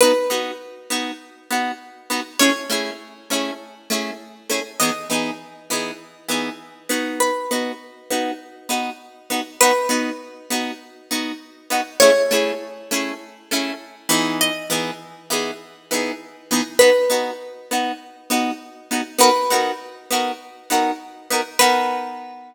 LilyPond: <<
  \new Staff \with { instrumentName = "Acoustic Guitar (steel)" } { \time 4/4 \key b \mixolydian \tempo 4 = 100 b'1 | cis''1 | dis''1 | b'2 r2 |
b'2 r2 | cis''1 | dis''1 | b'2 r2 |
b'4. r2 r8 | b'1 | }
  \new Staff \with { instrumentName = "Acoustic Guitar (steel)" } { \time 4/4 \key b \mixolydian <b dis' fis'>8 <b dis' fis'>4 <b dis' fis'>4 <b dis' fis'>4 <b dis' fis'>8 | <a cis' e' gis'>8 <a cis' e' gis'>4 <a cis' e' gis'>4 <a cis' e' gis'>4 <a cis' e' gis'>8 | <e b dis' gis'>8 <e b dis' gis'>4 <e b dis' gis'>4 <e b dis' gis'>4 <b dis' fis'>8~ | <b dis' fis'>8 <b dis' fis'>4 <b dis' fis'>4 <b dis' fis'>4 <b dis' fis'>8 |
<b dis' fis'>8 <b dis' fis'>4 <b dis' fis'>4 <b dis' fis'>4 <b dis' fis'>8 | <a cis' e' gis'>8 <a cis' e' gis'>4 <a cis' e' gis'>4 <a cis' e' gis'>4 <e b dis' gis'>8~ | <e b dis' gis'>8 <e b dis' gis'>4 <e b dis' gis'>4 <e b dis' gis'>4 <e b dis' gis'>8 | <b dis' fis'>8 <b dis' fis'>4 <b dis' fis'>4 <b dis' fis'>4 <b dis' fis'>8 |
<b dis' fis' ais'>8 <b dis' fis' ais'>4 <b dis' fis' ais'>4 <b dis' fis' ais'>4 <b dis' fis' ais'>8 | <b dis' fis' ais'>1 | }
>>